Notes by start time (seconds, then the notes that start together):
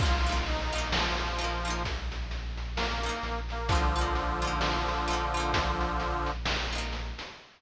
0.00 A#1 D#4 F4, kick, crash
0.05 A#3
0.27 D#4 F4, closed hi-hat
0.32 A#3
0.46 D#4, closed hi-hat
0.73 D#4 F4, closed hi-hat
0.78 A#3
0.92 F3, snare
1.18 closed hi-hat
1.38 D#4 F4, closed hi-hat
1.44 A#3
1.65 D#4 F4, closed hi-hat
1.70 A#3
1.85 kick, closed hi-hat
2.12 closed hi-hat
2.31 closed hi-hat
2.58 closed hi-hat
2.76 A#3, snare
3.03 D#4 F4, snare, closed hi-hat
3.09 A#3
3.23 A#1, closed hi-hat
3.49 A#3, snare, closed hi-hat
3.69 D3 F3 D#4 F4, kick, closed hi-hat
3.75 A#3
3.95 D#4 F4, closed hi-hat
4.01 A#3
4.15 closed hi-hat
4.42 D#4 F4, closed hi-hat
4.47 A#3
4.61 snare
4.88 closed hi-hat
5.08 D#4 F4, closed hi-hat
5.13 A#3
5.34 D#4 F4, closed hi-hat
5.40 A#3
5.54 kick, closed hi-hat
5.81 closed hi-hat
6.00 closed hi-hat
6.26 snare, closed hi-hat
6.46 snare
6.73 D#4 F4, closed hi-hat
6.78 A#3
6.93 closed hi-hat
7.18 snare, closed hi-hat